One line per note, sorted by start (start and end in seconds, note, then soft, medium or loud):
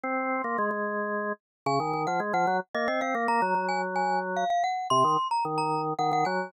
0.03 0.42 C4 medium
0.03 0.69 C6 medium
0.44 0.57 A#3 medium
0.58 0.70 G#3 medium
0.71 1.33 G#3 medium
1.66 1.79 C#3 loud
1.66 2.03 G#5 medium
1.80 1.93 D#3 medium
1.93 2.06 D#3 medium
2.07 2.20 F3 medium
2.07 2.20 F#5 medium
2.20 2.33 G#3 medium
2.33 2.46 F3 medium
2.33 2.57 F#5 medium
2.47 2.60 F#3 medium
2.75 2.88 A#3 medium
2.75 2.87 D#5 medium
2.88 3.01 C4 medium
2.88 3.01 D#5 medium
3.01 3.14 C4 medium
3.01 3.24 F5 medium
3.15 3.27 A#3 medium
3.28 3.41 A#3 medium
3.28 3.66 A#5 medium
3.42 3.54 F#3 medium
3.55 4.44 F#3 medium
3.69 3.81 G#5 medium
3.96 4.19 G#5 medium
4.36 4.49 F5 medium
4.50 4.63 F5 medium
4.64 4.87 F#5 medium
4.90 5.04 C3 loud
4.90 5.28 C6 medium
5.04 5.17 D#3 medium
5.31 5.44 A#5 medium
5.45 5.94 D#3 medium
5.58 5.81 A#5 medium
5.99 6.11 D#3 medium
5.99 6.11 F#5 medium
6.12 6.24 D#3 medium
6.12 6.26 F#5 medium
6.25 6.51 F#3 medium
6.25 6.51 G#5 medium